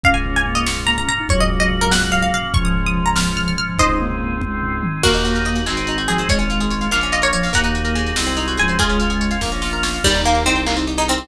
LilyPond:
<<
  \new Staff \with { instrumentName = "Harpsichord" } { \time 6/8 \key des \major \tempo 4. = 96 f''16 aes''16 r16 aes''16 r16 ees''16 des'''8 bes''16 bes''16 bes''8 | des''16 ees''16 r16 ees''16 r16 bes'16 ges''8 f''16 f''16 f''8 | des'''16 ees'''16 r16 ees'''16 r16 bes''16 f'''8 f'''16 f'''16 f'''8 | <c'' ees''>2 r4 |
<ges' bes'>2~ <ges' bes'>8 aes'8 | des''8 r4 f''8 ees''16 des''16 des''8 | <ges'' bes''>2~ <ges'' bes''>8 aes''8 | <f' aes'>2 r4 |
\key ees \major g8 bes8 c'8 r8. ees'16 c'8 | }
  \new Staff \with { instrumentName = "Ocarina" } { \time 6/8 \key des \major des'8 des'8 bes8 r8 bes16 des'16 r16 ees'16 | ges2. | f2~ f8 f8 | ees'8 bes4 r4. |
bes4. r4 f8 | aes4. r4 f8 | bes4. r4 f8 | aes4. r4. |
\key ees \major ees'2~ ees'8 ees'8 | }
  \new Staff \with { instrumentName = "Orchestral Harp" } { \time 6/8 \key des \major r2. | r2. | r2. | r2. |
bes16 ees'16 ges'16 bes'16 ees''16 ges''16 aes16 c'16 ees'16 ges'16 aes'16 c''16 | aes16 des'16 f'16 aes'16 des''16 f''16 bes16 des'16 f'16 bes'16 des''16 f''16 | bes16 ees'16 ges'16 bes'16 aes8. c'16 ees'16 ges'16 aes'16 c''16 | aes16 des'16 f'16 aes'16 des''16 f''16 bes16 des'16 f'16 bes'16 des''16 f''16 |
\key ees \major bes16 ees'16 g'16 bes'16 ees''16 g''16 bes16 c'16 ees'16 aes'16 bes'16 c''16 | }
  \new Staff \with { instrumentName = "Violin" } { \clef bass \time 6/8 \key des \major des,2. | des,2. | des,2. | des,2. |
ees,4. aes,,4. | aes,,4. bes,,4. | ees,4. c,4 des,8~ | des,4. bes,,4. |
\key ees \major ees,4 c,2 | }
  \new Staff \with { instrumentName = "Drawbar Organ" } { \time 6/8 \key des \major <bes des' f'>2. | <bes des' ges'>2. | <aes des' f'>2. | <aes c' ees'>2. |
<bes ees' ges'>4. <aes c' ees' ges'>4. | <aes des' f'>4. <bes des' f'>4. | <bes ees' ges'>4. <aes c' ees' ges'>4. | <aes des' f'>4. <bes des' f'>4. |
\key ees \major r2. | }
  \new DrumStaff \with { instrumentName = "Drums" } \drummode { \time 6/8 <bd tomfh>16 tomfh16 tomfh16 tomfh16 tomfh16 tomfh16 sn16 tomfh16 tomfh16 tomfh16 tomfh16 tomfh16 | <bd tomfh>16 tomfh16 tomfh16 tomfh16 tomfh16 tomfh16 sn16 tomfh16 tomfh16 tomfh16 tomfh16 tomfh16 | <bd tomfh>16 tomfh16 tomfh16 tomfh16 tomfh16 tomfh16 sn16 tomfh16 tomfh16 tomfh16 tomfh16 tomfh16 | <bd tomfh>16 tomfh16 tomfh16 tomfh16 tomfh16 tomfh16 <bd tommh>8 tomfh8 toml8 |
<cymc bd>16 hh16 hh16 hh16 hh16 hh16 hc16 hh16 hh16 hh16 hh16 hh16 | <hh bd>16 hh16 hh16 hh16 hh16 hh16 hc16 hh16 hh16 hh16 hh16 hho16 | <hh bd>16 hh16 hh16 hh16 hh16 hh16 sn16 hh16 hh16 hh16 hh16 hh16 | <hh bd>16 hh16 hh16 hh16 hh16 hh16 <bd sn>8 sn8 sn8 |
<cymc bd>16 cymr16 cymr16 cymr16 cymr16 cymr16 hc16 cymr16 cymr16 cymr16 cymr16 cymr16 | }
>>